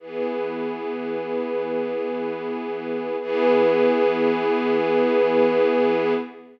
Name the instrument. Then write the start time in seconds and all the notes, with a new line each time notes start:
string ensemble 1
0.00 E3 B3 G#4
3.20 E3 B3 G#4